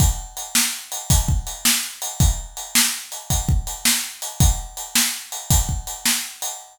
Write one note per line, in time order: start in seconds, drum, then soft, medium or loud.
0.00 kick loud
0.00 closed hi-hat medium
0.37 closed hi-hat medium
0.55 snare loud
0.92 closed hi-hat medium
1.10 kick medium
1.10 closed hi-hat loud
1.28 kick medium
1.47 closed hi-hat medium
1.65 snare loud
2.02 closed hi-hat medium
2.20 kick loud
2.20 closed hi-hat medium
2.57 closed hi-hat medium
2.75 snare loud
3.12 closed hi-hat medium
3.30 kick medium
3.30 closed hi-hat medium
3.49 kick medium
3.67 closed hi-hat medium
3.85 snare loud
4.22 closed hi-hat medium
4.40 kick loud
4.40 closed hi-hat loud
4.77 closed hi-hat medium
4.95 snare loud
5.32 closed hi-hat medium
5.50 kick medium
5.50 closed hi-hat loud
5.69 kick medium
5.87 closed hi-hat medium
6.06 snare loud
6.42 closed hi-hat medium